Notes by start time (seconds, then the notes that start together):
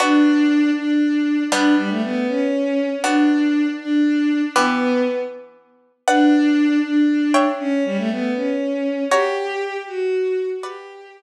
0.00 B3 D4 F#4
0.76 D4
1.52 G3 B3 D4
1.77 G3
1.90 A3
2.03 B3
2.28 C#4
3.04 B3 D4 F#4
3.80 D4
4.56 E3 B3 G4
6.08 D4 B4 D5 F#5
6.84 D4
7.34 C#5 E5 G5
7.59 C#4
7.85 G3
7.97 A3
8.10 B3
8.35 C#4
9.11 F#4 G4 C#5 A#5
9.87 F#4
10.63 G4 B4 D5 F#5